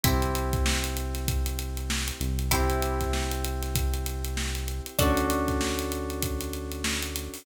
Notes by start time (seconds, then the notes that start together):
0.03 C2 C4 E4 G4 C5, kick, closed hi-hat
0.22 closed hi-hat
0.35 closed hi-hat
0.53 kick, closed hi-hat
0.66 snare
0.84 closed hi-hat
0.97 closed hi-hat
1.15 snare, closed hi-hat
1.28 kick, closed hi-hat
1.46 closed hi-hat
1.59 closed hi-hat
1.77 closed hi-hat
1.90 snare
2.08 closed hi-hat
2.20 C2, closed hi-hat
2.39 closed hi-hat
2.51 C4 E4 G4 C5, kick, closed hi-hat
2.70 closed hi-hat
2.82 closed hi-hat
3.01 kick, snare, closed hi-hat
3.13 snare
3.31 closed hi-hat
3.44 closed hi-hat
3.62 snare, closed hi-hat
3.75 kick, closed hi-hat
3.94 closed hi-hat
4.06 closed hi-hat
4.24 closed hi-hat
4.37 snare
4.55 snare, closed hi-hat
4.68 closed hi-hat
4.86 closed hi-hat
4.99 D2 C#4 D4 F#4 A4 C#5, kick, closed hi-hat
5.17 closed hi-hat
5.30 snare, closed hi-hat
5.48 kick, snare, closed hi-hat
5.61 snare
5.79 snare, closed hi-hat
5.92 closed hi-hat
6.10 closed hi-hat
6.22 kick, closed hi-hat
6.41 closed hi-hat
6.53 closed hi-hat
6.72 closed hi-hat
6.84 snare
7.02 snare, closed hi-hat
7.15 snare, closed hi-hat
7.34 open hi-hat